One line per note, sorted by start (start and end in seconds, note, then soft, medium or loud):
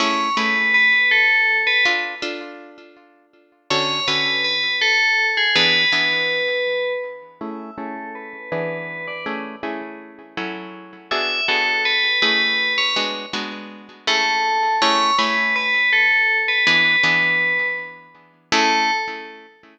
0.00 0.29 A3 medium
0.00 0.29 C#4 medium
0.00 0.29 E4 medium
0.00 0.29 G#4 medium
0.00 0.36 C#5 medium
0.37 0.96 A3 medium
0.37 0.96 C#4 medium
0.37 0.96 E4 medium
0.37 0.96 G#4 medium
0.37 0.73 B4 medium
0.74 1.10 B4 medium
1.11 1.58 A4 medium
1.67 1.84 B4 medium
1.85 2.15 D4 medium
1.85 2.15 F4 medium
1.85 2.15 A4 medium
2.22 2.81 D4 medium
2.22 2.81 F4 medium
2.22 2.81 A4 medium
3.70 4.00 D3 medium
3.70 4.00 C#4 medium
3.70 4.00 F#4 medium
3.70 4.00 A4 medium
3.70 4.06 C#5 medium
4.08 4.67 D3 medium
4.08 4.67 C#4 medium
4.08 4.67 F#4 medium
4.08 4.67 A4 medium
4.08 4.42 B4 medium
4.44 4.75 B4 medium
4.81 5.26 A4 medium
5.37 5.55 G#4 medium
5.55 5.85 E3 medium
5.55 5.85 B3 medium
5.55 5.85 D4 medium
5.55 5.85 G#4 medium
5.55 6.93 B4 medium
5.92 6.52 E3 medium
5.92 6.52 B3 medium
5.92 6.52 D4 medium
5.92 6.52 G#4 medium
7.41 7.71 A3 medium
7.41 7.71 C#4 medium
7.41 7.71 E4 medium
7.41 7.71 G#4 medium
7.41 7.75 E5 medium
7.78 8.37 A3 medium
7.78 8.37 C#4 medium
7.78 8.37 E4 medium
7.78 8.37 G#4 medium
7.78 8.09 A4 medium
8.15 8.49 B4 medium
8.52 9.11 E3 medium
8.52 9.11 B3 medium
8.52 9.11 D4 medium
8.52 9.11 G#4 medium
8.52 9.05 B4 medium
9.08 9.25 D5 medium
9.26 9.56 A3 medium
9.26 9.56 C#4 medium
9.26 9.56 E4 medium
9.26 9.56 G#4 medium
9.63 10.22 A3 medium
9.63 10.22 C#4 medium
9.63 10.22 E4 medium
9.63 10.22 G#4 medium
10.37 10.97 F#3 medium
10.37 10.97 C#4 medium
10.37 10.97 E4 medium
10.37 10.97 A4 medium
11.11 11.41 B3 medium
11.11 11.41 D4 medium
11.11 11.41 F#4 medium
11.11 11.41 G#4 medium
11.11 11.44 E5 medium
11.48 12.08 B3 medium
11.48 12.08 D4 medium
11.48 12.08 F#4 medium
11.48 12.08 G#4 medium
11.48 11.81 A4 medium
11.85 12.19 B4 medium
12.22 12.81 A3 medium
12.22 12.81 C#4 medium
12.22 12.81 E4 medium
12.22 12.81 G#4 medium
12.22 12.73 B4 medium
12.78 12.95 C#5 medium
12.96 13.26 G#3 medium
12.96 13.26 B3 medium
12.96 13.26 D4 medium
12.96 13.26 F#4 medium
13.33 13.93 G#3 medium
13.33 13.93 B3 medium
13.33 13.93 D4 medium
13.33 13.93 F#4 medium
14.07 14.67 A3 medium
14.07 14.67 C#4 medium
14.07 14.67 E4 medium
14.07 14.67 G#4 medium
14.07 14.75 A4 medium
14.82 15.11 A3 medium
14.82 15.11 C#4 medium
14.82 15.11 E4 medium
14.82 15.11 G#4 medium
14.82 15.15 C#5 loud
15.18 15.78 A3 medium
15.18 15.78 C#4 medium
15.18 15.78 E4 medium
15.18 15.78 G#4 medium
15.18 15.54 B4 medium
15.56 15.90 B4 medium
15.93 16.38 A4 medium
16.48 16.66 B4 medium
16.67 16.96 E3 medium
16.67 16.96 B3 medium
16.67 16.96 D4 medium
16.67 16.96 G#4 medium
16.67 17.67 B4 medium
17.03 17.63 E3 medium
17.03 17.63 B3 medium
17.03 17.63 D4 medium
17.03 17.63 G#4 medium
18.52 18.91 A3 loud
18.52 18.91 C#4 loud
18.52 18.91 E4 loud
18.52 18.91 G#4 loud
18.52 18.91 A4 loud